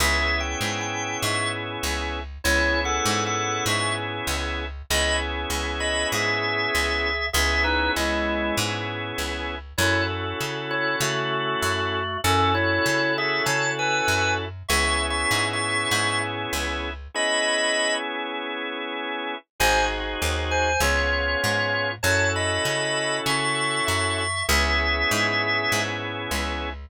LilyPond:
<<
  \new Staff \with { instrumentName = "Drawbar Organ" } { \time 4/4 \key cis \minor \tempo 4 = 98 \tuplet 3/2 { <gis' e''>4 g''4 g''4 } <e'' cis'''>8 r4. | \tuplet 3/2 { <e' cis''>4 <a' fis''>4 <a' fis''>4 } <e'' cis'''>8 r4. | <dis'' b''>8 r4 <dis'' b''>8 <gis' e''>2 | <gis' e''>8 <dis' b'>8 <gis e'>4 r2 |
<e' cis''>8 r4 <e' cis''>8 <a fis'>2 | <cis' a'>8 <e' cis''>4 <gis' e''>8 <cis'' a''>8 <b' gis''>4 r8 | \tuplet 3/2 { <e'' cis'''>4 <e'' cis'''>4 <e'' cis'''>4 } <e'' cis'''>8 r4. | <dis'' b''>4. r2 r8 |
<bis' gis''>8 r4 <bis' gis''>8 <eis' cis''>2 | <cis'' a''>8 <dis'' b''>4. <e'' cis'''>4 <e'' cis'''>8 <e'' cis'''>8 | <gis' e''>2~ <gis' e''>8 r4. | }
  \new Staff \with { instrumentName = "Drawbar Organ" } { \time 4/4 \key cis \minor <b cis' e' gis'>1 | <b cis' e' gis'>1 | <b cis' e' gis'>1 | <b cis' e' gis'>1 |
<cis' e' fis' a'>1 | <cis' e' fis' a'>1 | <b cis' e' gis'>1 | <b cis' e' gis'>1 |
<bis dis' fis' gis'>2 <b cis' eis' gis'>2 | <cis' e' fis' a'>1 | <b cis' e' gis'>1 | }
  \new Staff \with { instrumentName = "Electric Bass (finger)" } { \clef bass \time 4/4 \key cis \minor cis,4 gis,4 gis,4 cis,4 | cis,4 gis,4 gis,4 cis,4 | cis,4 cis,4 gis,4 cis,4 | cis,4 cis,4 gis,4 cis,4 |
fis,4 cis4 cis4 fis,4 | fis,4 cis4 cis4 fis,4 | cis,4 gis,4 gis,4 cis,4 | r1 |
gis,,4 dis,4 cis,4 gis,4 | fis,4 cis4 cis4 fis,4 | cis,4 gis,4 gis,4 cis,4 | }
>>